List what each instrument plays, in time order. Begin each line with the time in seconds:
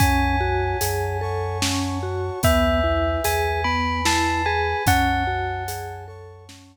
0.00 synth bass 2 F#2, vibraphone C#4, brass section C#5 F#5 G#5 A5, tubular bells G#5, kick, closed hi-hat
0.41 vibraphone F#4
0.81 synth bass 2 F#2, vibraphone G#4, closed hi-hat
1.21 vibraphone A4, brass section C#5 F#5 A5 C#6
1.62 vibraphone C#4, snare
2.03 vibraphone F#4
2.43 synth bass 2 E2, vibraphone B3, brass section B4 E5 G#5, tubular bells E5, kick, closed hi-hat
2.84 vibraphone E4
3.24 synth bass 2 E2, vibraphone G#4, tubular bells G#5, closed hi-hat
3.64 vibraphone B3, brass section B4 G#5 B5, tubular bells B5
4.05 vibraphone E4, tubular bells A5, snare
4.46 vibraphone G#4, tubular bells G#5
4.86 synth bass 2 F#2, vibraphone C#4, brass section C#5 F#5 G#5 A5, tubular bells F#5, kick, closed hi-hat
5.27 vibraphone F#4
5.68 vibraphone G#4, closed hi-hat
6.07 vibraphone A4, brass section C#5 F#5 A5 C#6
6.49 vibraphone C#4, snare